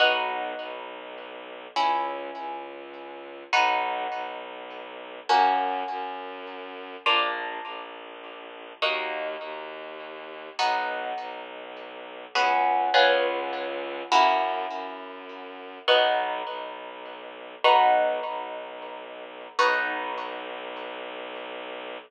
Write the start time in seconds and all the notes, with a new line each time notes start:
0.00 B1 B3 D#4 F#4
0.59 B1
1.76 C#2 C#4 E4 G#4
2.35 C#2
3.53 B1 B3 D#4 F#4
4.12 B1
5.29 F#2 A#3 C#4 F#4
5.88 F#2
7.06 A#1 A#3 D4 F4
7.65 A#1
8.82 D#2 A#3 D#4 F#4
9.41 D#2
10.59 B1 B3 D#4 F#4
11.18 B1
12.35 C#2 B3 C#4 F#4 G#4
12.94 C#2 B3 C#4 F4 G#4
14.12 F#2 A#3 C#4 E4 F#4
14.71 F#2
15.88 B1 B3 D#4 F#4
16.47 B1
17.64 B1 B3 D#4 F#4
18.25 B1
19.59 B1 B3 D#4 F#4